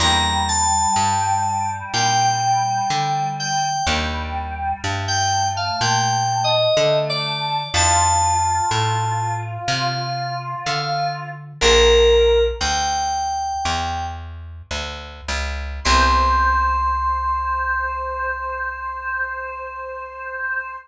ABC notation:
X:1
M:4/4
L:1/16
Q:1/4=62
K:Cmix
V:1 name="Electric Piano 2"
b2 a6 g6 g2 | z5 g2 f (3g4 _e4 d4 | a8 f3 z f2 z2 | "^rit." B4 g6 z6 |
c'16 |]
V:2 name="Choir Aahs"
G,16 | G,4 A,8 A,4 | F16 | "^rit." B4 z12 |
c16 |]
V:3 name="Acoustic Guitar (steel)"
[B,DEG]8 [B,DEG]8 | [B,D_EG]16 | [CDEF]16 | "^rit." [B,DEG]16 |
[=B,CEG]16 |]
V:4 name="Electric Bass (finger)" clef=bass
E,,4 G,,4 B,,4 D,4 | _E,,4 G,,4 B,,4 D,4 | F,,4 A,,4 C,4 D,4 | "^rit." B,,,4 D,,4 E,,4 D,,2 _D,,2 |
C,,16 |]